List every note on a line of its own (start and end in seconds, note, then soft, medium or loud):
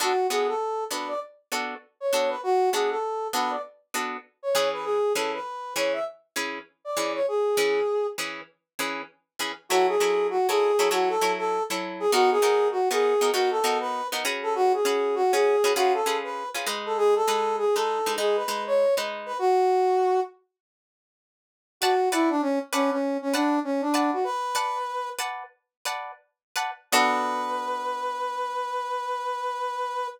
0.00 0.13 B3 medium
0.00 0.13 D4 medium
0.00 0.13 F#4 medium
0.00 0.27 F#4 medium
0.00 0.13 A4 medium
0.30 0.53 B3 medium
0.30 0.53 D4 medium
0.30 0.53 F#4 medium
0.30 0.47 G#4 medium
0.30 0.53 A4 medium
0.48 0.84 A4 medium
0.91 1.14 B3 medium
0.91 1.14 D4 medium
0.91 1.14 F#4 medium
0.91 1.14 A4 medium
0.91 1.08 B4 medium
1.08 1.20 D5 medium
1.52 1.75 B3 medium
1.52 1.75 D4 medium
1.52 1.75 F#4 medium
1.52 1.75 A4 medium
2.00 2.30 C#5 medium
2.13 2.36 B3 medium
2.13 2.36 D4 medium
2.13 2.36 F#4 medium
2.13 2.36 A4 medium
2.29 2.41 B4 medium
2.43 2.70 F#4 medium
2.72 2.96 B3 medium
2.72 2.96 D4 medium
2.72 2.96 F#4 medium
2.72 2.89 G#4 medium
2.72 2.96 A4 medium
2.90 3.28 A4 medium
3.33 3.56 B3 medium
3.33 3.56 D4 medium
3.33 3.56 F#4 medium
3.33 3.56 A4 medium
3.33 3.51 B4 medium
3.50 3.62 D5 medium
3.94 4.17 B3 medium
3.94 4.17 D4 medium
3.94 4.17 F#4 medium
3.94 4.17 A4 medium
4.43 4.69 C#5 medium
4.55 4.98 E3 medium
4.55 4.98 C#4 medium
4.55 4.98 G#4 medium
4.55 4.98 B4 medium
4.73 4.85 B4 medium
4.84 5.13 G#4 medium
5.15 5.38 E3 medium
5.15 5.38 C#4 medium
5.15 5.38 G#4 medium
5.15 5.32 A4 medium
5.15 5.38 B4 medium
5.34 5.74 B4 medium
5.76 5.99 E3 medium
5.76 5.99 C#4 medium
5.76 5.99 G#4 medium
5.76 5.99 B4 medium
5.76 5.93 C#5 medium
5.93 6.05 E5 medium
6.36 6.59 E3 medium
6.36 6.59 C#4 medium
6.36 6.59 G#4 medium
6.36 6.59 B4 medium
6.85 7.13 D5 medium
6.97 7.20 E3 medium
6.97 7.20 C#4 medium
6.97 7.20 G#4 medium
6.97 7.20 B4 medium
7.15 7.26 C#5 medium
7.28 8.07 G#4 medium
7.57 7.80 E3 medium
7.57 7.80 C#4 medium
7.57 7.80 G#4 medium
7.57 7.80 B4 medium
8.18 8.41 E3 medium
8.18 8.41 C#4 medium
8.18 8.41 G#4 medium
8.18 8.41 B4 medium
8.79 9.02 E3 medium
8.79 9.02 C#4 medium
8.79 9.02 G#4 medium
8.79 9.02 B4 medium
9.39 9.52 E3 medium
9.39 9.52 C#4 medium
9.39 9.52 G#4 medium
9.39 9.52 B4 medium
9.69 9.96 F#3 medium
9.69 9.96 E4 medium
9.69 9.86 F#4 medium
9.69 9.96 A4 medium
9.69 9.96 C#5 medium
9.88 10.27 G#4 medium
10.00 10.38 F#3 medium
10.00 10.38 E4 medium
10.00 10.38 A4 medium
10.00 10.38 C#5 medium
10.30 10.47 F#4 medium
10.49 10.72 F#3 medium
10.49 10.72 E4 medium
10.49 10.89 G#4 medium
10.49 10.72 A4 medium
10.49 10.72 C#5 medium
10.79 10.89 F#3 medium
10.79 10.89 E4 medium
10.79 10.89 A4 medium
10.79 10.89 C#5 medium
10.91 11.16 F#3 medium
10.91 11.16 E4 medium
10.91 11.09 F#4 medium
10.91 11.16 A4 medium
10.91 11.16 C#5 medium
11.09 11.32 A4 medium
11.21 11.59 F#3 medium
11.21 11.59 E4 medium
11.21 11.59 A4 medium
11.21 11.59 C#5 medium
11.38 11.63 A4 medium
11.70 12.05 F#3 medium
11.70 12.05 E4 medium
11.70 12.05 A4 medium
11.70 12.05 C#5 medium
12.00 12.11 G#4 medium
12.12 12.38 B3 medium
12.12 12.38 D#4 medium
12.12 12.30 F#4 medium
12.12 12.38 F#4 medium
12.12 12.38 A#4 medium
12.31 12.68 G#4 medium
12.42 12.80 B3 medium
12.42 12.80 D#4 medium
12.42 12.80 F#4 medium
12.42 12.80 A#4 medium
12.71 12.89 F#4 medium
12.91 13.14 B3 medium
12.91 13.14 D#4 medium
12.91 13.14 F#4 medium
12.91 13.30 G#4 medium
12.91 13.14 A#4 medium
13.21 13.31 B3 medium
13.21 13.31 D#4 medium
13.21 13.31 F#4 medium
13.21 13.31 A#4 medium
13.33 13.59 B3 medium
13.33 13.59 D#4 medium
13.33 13.50 F#4 medium
13.33 13.59 F#4 medium
13.33 13.59 A#4 medium
13.51 13.78 A4 medium
13.64 14.01 B3 medium
13.64 14.01 D#4 medium
13.64 14.01 F#4 medium
13.64 14.01 A#4 medium
13.80 14.07 B4 medium
14.12 14.24 B3 medium
14.12 14.24 D#4 medium
14.12 14.24 F#4 medium
14.12 14.24 A#4 medium
14.25 14.80 C#4 medium
14.25 14.80 F#4 medium
14.25 14.80 G#4 medium
14.25 14.80 B4 medium
14.43 14.54 A4 medium
14.55 14.72 F#4 medium
14.74 15.15 G#4 medium
14.85 15.23 C#4 medium
14.85 15.23 F#4 medium
14.85 15.23 G#4 medium
14.85 15.23 B4 medium
15.15 15.32 F#4 medium
15.33 15.56 C#4 medium
15.33 15.56 F#4 medium
15.33 15.72 G#4 medium
15.33 15.56 G#4 medium
15.33 15.56 B4 medium
15.64 15.74 C#4 medium
15.64 15.74 F#4 medium
15.64 15.74 G#4 medium
15.64 15.74 B4 medium
15.76 16.02 C#4 medium
15.76 16.02 F4 medium
15.76 15.93 F#4 medium
15.76 16.02 G#4 medium
15.76 16.02 B4 medium
15.94 16.17 A4 medium
16.06 16.44 C#4 medium
16.06 16.44 F4 medium
16.06 16.44 G#4 medium
16.06 16.44 B4 medium
16.24 16.49 B4 medium
16.55 16.66 C#4 medium
16.55 16.66 F4 medium
16.55 16.66 G#4 medium
16.55 16.66 B4 medium
16.67 17.22 G#3 medium
16.67 17.22 D#4 medium
16.67 17.22 B4 medium
16.86 16.97 A4 medium
16.97 17.14 G#4 loud
17.16 17.56 A4 medium
17.28 17.65 G#3 medium
17.28 17.65 D#4 medium
17.28 17.65 B4 medium
17.58 17.75 G#4 medium
17.75 17.99 G#3 medium
17.75 17.99 D#4 medium
17.75 18.14 A4 medium
17.75 17.99 B4 medium
18.06 18.16 G#3 medium
18.06 18.16 D#4 medium
18.06 18.16 B4 medium
18.18 18.43 G#3 medium
18.18 18.43 D#4 medium
18.18 18.36 G#4 medium
18.18 18.43 B4 medium
18.36 18.63 B4 medium
18.48 18.86 G#3 medium
18.48 18.86 D#4 medium
18.48 18.86 B4 medium
18.67 18.95 C#5 medium
18.97 19.32 G#3 medium
18.97 19.32 D#4 medium
18.97 19.32 B4 medium
19.26 19.38 B4 medium
19.39 20.20 F#4 medium
21.81 22.09 F#4 medium
21.81 21.94 B4 loud
21.81 21.94 D5 medium
21.81 21.94 F#5 medium
21.81 21.94 A5 medium
22.12 22.29 E4 medium
22.12 22.35 B4 medium
22.12 22.35 D5 medium
22.12 22.35 F#5 medium
22.12 22.35 A5 medium
22.30 22.41 D4 medium
22.42 22.59 C#4 medium
22.73 22.90 C#4 medium
22.73 22.96 B4 loud
22.73 22.96 D5 medium
22.73 22.96 F#5 medium
22.73 22.96 A5 medium
22.91 23.17 C#4 medium
23.22 23.34 C#4 medium
23.33 23.59 D4 medium
23.33 23.57 B4 medium
23.33 23.57 D5 medium
23.33 23.57 F#5 medium
23.33 23.57 A5 medium
23.64 23.82 C#4 medium
23.81 24.11 D4 medium
23.94 24.17 B4 medium
23.94 24.17 D5 medium
23.94 24.17 F#5 medium
23.94 24.17 A5 medium
24.13 24.24 F#4 medium
24.24 25.09 B4 medium
24.55 24.79 B4 medium
24.55 24.79 D5 medium
24.55 24.79 F#5 medium
24.55 24.79 A5 medium
25.19 25.44 B4 medium
25.19 25.44 D5 medium
25.19 25.44 F#5 medium
25.19 25.44 A5 medium
25.85 26.12 B4 medium
25.85 26.12 D5 medium
25.85 26.12 F#5 medium
25.85 26.12 A5 medium
26.56 26.71 B4 medium
26.56 26.71 D5 medium
26.56 26.71 F#5 medium
26.56 26.71 A5 medium
26.92 30.08 B3 medium
26.92 30.08 D4 loud
26.92 30.08 F#4 loud
26.92 30.08 A4 loud
26.92 30.07 B4 loud